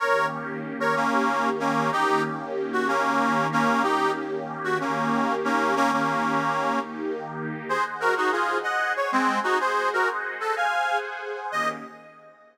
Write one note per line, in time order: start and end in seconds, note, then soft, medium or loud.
0.00 0.95 D#3 medium
0.00 0.95 A#3 medium
0.00 0.95 C#4 medium
0.00 0.95 G4 medium
0.00 0.26 A#4 medium
0.00 0.26 C#5 medium
0.80 0.95 A#4 medium
0.80 0.95 C#5 medium
0.95 1.90 D#3 medium
0.95 1.90 A#3 medium
0.95 1.49 A#3 medium
0.95 1.49 C#4 medium
0.95 1.90 D#4 medium
0.95 1.90 G4 medium
1.60 1.90 A#3 medium
1.60 1.90 C#4 medium
1.92 2.88 D#3 medium
1.92 2.88 A#3 medium
1.92 2.88 C#4 medium
1.92 2.22 D#4 medium
1.92 2.22 G4 medium
1.92 2.88 G4 medium
2.73 2.87 F#4 medium
2.88 3.84 D#3 medium
2.88 3.47 A#3 medium
2.88 3.84 A#3 medium
2.88 3.47 C#4 medium
2.88 3.84 D#4 medium
2.88 3.84 G4 medium
3.52 3.82 A#3 medium
3.52 3.82 C#4 medium
3.83 4.79 D#3 medium
3.83 4.79 A#3 medium
3.83 4.79 C#4 medium
3.83 4.11 D#4 medium
3.83 4.11 G4 medium
3.83 4.79 G4 medium
4.64 4.78 F#4 medium
4.80 5.75 D#3 medium
4.80 5.75 A#3 medium
4.80 5.35 A#3 medium
4.80 5.35 C#4 medium
4.80 5.75 D#4 medium
4.80 5.75 G4 medium
5.44 5.75 A#3 medium
5.44 5.75 C#4 medium
5.76 6.71 D#3 medium
5.76 6.71 A#3 medium
5.76 5.91 A#3 medium
5.76 6.71 C#4 medium
5.76 5.91 C#4 loud
5.76 6.71 G4 medium
5.93 6.79 A#3 medium
5.93 6.79 C#4 medium
6.73 7.68 D#3 medium
6.73 7.68 A#3 medium
6.73 7.68 D#4 medium
6.73 7.68 G4 medium
7.67 8.62 G#4 medium
7.67 7.84 G#4 medium
7.67 8.62 C5 medium
7.67 7.84 C5 medium
7.67 8.62 D#5 medium
7.67 8.62 F#5 medium
8.00 8.14 F#4 medium
8.00 8.14 A#4 medium
8.17 8.30 D#4 medium
8.17 8.30 F#4 medium
8.32 8.58 F4 medium
8.32 8.58 G#4 medium
8.63 9.58 G#4 medium
8.63 9.58 C5 medium
8.63 8.93 D#5 medium
8.63 8.93 F#5 medium
8.63 9.58 F#5 medium
8.63 9.59 G#5 medium
8.96 9.11 C#5 medium
9.12 9.39 G#3 medium
9.12 9.39 C4 medium
9.44 9.58 D#4 medium
9.44 9.58 F#4 medium
9.59 10.54 G#4 medium
9.59 9.89 G#4 medium
9.59 10.54 C5 medium
9.59 9.89 C5 medium
9.59 10.54 D#5 medium
9.59 10.54 F#5 medium
9.93 10.09 F#4 medium
9.93 10.09 A#4 medium
10.40 10.55 A4 medium
10.56 11.51 G#4 medium
10.56 11.51 C5 medium
10.56 10.98 F5 medium
10.56 11.51 F#5 medium
10.56 11.51 G#5 medium
10.56 10.98 G#5 medium
11.52 11.68 D#3 loud
11.52 11.68 A#3 loud
11.52 11.68 C#4 loud
11.52 11.68 G4 loud
11.52 11.69 D#5 loud